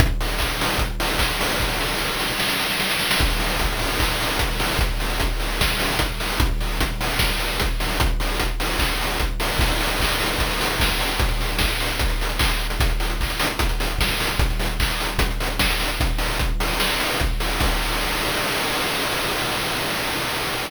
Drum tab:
CC |----------------|----------------|x---------------|----------------|
HH |x-o---o-x-o---o-|----------------|--o-x-o---o-x-o-|x-o-x-o---o-x-o-|
CP |----x-------x---|----------------|--------x-------|----------------|
SD |----------------|o-o-o-o-oooooooo|----------------|--------o-------|
BD |o---o---o---o---|o---------------|o---o---o---o---|o---o---o---o---|

CC |----------------|----------------|x---------------|----------------|
HH |x-o-x-o---o-x-o-|x-o-x-o---o-x-o-|-xox-xoxxxox--ox|xxox-xoxxxox-x-x|
CP |----------------|--------x-------|----x-----------|------------x---|
SD |--------o-------|----------------|------------o---|----o-----------|
BD |o---o---o---o---|o---o---o---o---|o---o---o---o---|o---o---o---o---|

CC |----------------|----------------|----------------|x---------------|
HH |xxox-xoxxxox-xox|xxox-xoxxxox-xox|x-o-x-o---o-x-o-|----------------|
CP |----x-----------|----x-----------|----------------|----------------|
SD |------------o---|------------o---|--------o-------|----------------|
BD |o---o---o---o---|o---o---o---o---|o---o-------o---|o---------------|